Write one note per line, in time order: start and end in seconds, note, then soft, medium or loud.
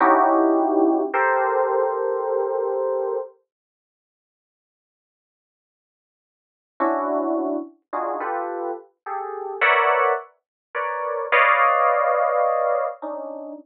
0.00 1.02 C#4 loud
0.00 1.02 D#4 loud
0.00 1.02 E4 loud
0.00 1.02 F#4 loud
0.00 1.02 G4 loud
1.13 3.17 G4 medium
1.13 3.17 A4 medium
1.13 3.17 A#4 medium
1.13 3.17 C5 medium
6.80 7.56 C#4 medium
6.80 7.56 D4 medium
6.80 7.56 E4 medium
6.80 7.56 F#4 medium
7.93 8.18 D4 medium
7.93 8.18 D#4 medium
7.93 8.18 F4 medium
7.93 8.18 F#4 medium
7.93 8.18 G#4 medium
8.20 8.71 F4 medium
8.20 8.71 G4 medium
8.20 8.71 A4 medium
8.20 8.71 B4 medium
9.06 9.57 G4 medium
9.06 9.57 G#4 medium
9.06 9.57 A4 medium
9.61 10.12 A#4 medium
9.61 10.12 B4 medium
9.61 10.12 C#5 medium
9.61 10.12 D5 medium
9.61 10.12 E5 medium
9.61 10.12 F#5 medium
10.75 11.25 A#4 medium
10.75 11.25 B4 medium
10.75 11.25 C#5 medium
10.75 11.25 D5 medium
11.32 12.85 B4 loud
11.32 12.85 C#5 loud
11.32 12.85 D5 loud
11.32 12.85 D#5 loud
11.32 12.85 F5 loud
13.02 13.53 C#4 medium
13.02 13.53 D4 medium
13.02 13.53 D#4 medium